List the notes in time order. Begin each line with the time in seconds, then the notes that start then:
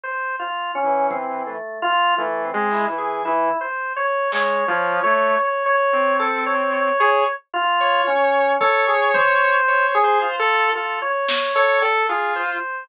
0.04 C5
0.40 F4
0.75 C#4
0.84 E3
1.11 C4, kick
1.46 A3
1.82 F4
2.18 E3 A3
2.45 C4
2.54 G#3
2.71 E4, clap
2.89 E3
2.98 G#4
3.25 E3 E4
3.61 C5
3.96 C#5
4.32 G#3 C#5, clap
4.68 F3 C#5
5.04 A3 C#5
5.39 C#5, closed hi-hat
5.66 C#5
5.93 C4
6.20 A4
6.46 C#5
6.73 C#5
7.00 G#4 C#5
7.54 F4
7.80 C#5
8.07 C#4
8.61 A4 C#5, kick
8.88 G#4
9.14 C5, floor tom
9.68 C#5
9.95 G#4
10.04 C5
10.21 F4
10.39 A4
10.75 F4 A4
11.02 C#5
11.29 C#5, snare
11.55 A4 C#5
11.82 A4, cowbell
12.09 F4 G#4
12.36 C5